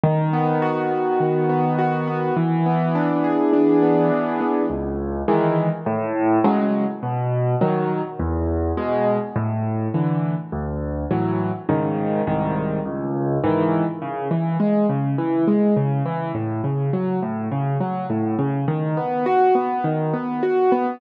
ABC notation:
X:1
M:4/4
L:1/8
Q:1/4=103
K:A
V:1 name="Acoustic Grand Piano"
^D, B, F B, D, B, F B, | E, B, D G D B, E, B, | [K:F#m] C,,2 [^D,E,G,]2 A,,2 [C,F,G,]2 | B,,2 [^D,F,]2 E,,2 [B,,G,]2 |
A,,2 [D,E,]2 D,,2 [A,,E,F,]2 | [G,,C,^D,]2 [^B,,,G,,D,]2 C,,2 [G,,D,E,]2 | [K:A] C, E, G, C, E, G, C, E, | A,, C, F, A,, C, F, A,, C, |
^D, B, F B, D, B, F B, |]